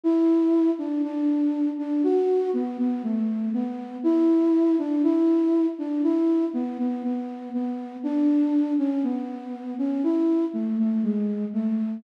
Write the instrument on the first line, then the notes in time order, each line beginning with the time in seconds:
flute
0.04 E4
0.78 D4
1.04 D4
1.78 D4
2.04 F#4
2.53 B3
2.79 B3
3.04 A3
3.54 B3
4.04 E4
4.79 D4
5.04 E4
5.79 D4
6.04 E4
6.54 B3
6.79 B3
7.04 B3
7.54 B3
8.04 D4
8.79 C#4
9.04 B3
9.79 C#4
10.04 E4
10.54 A3
10.79 A3
11.04 G#3
11.54 A3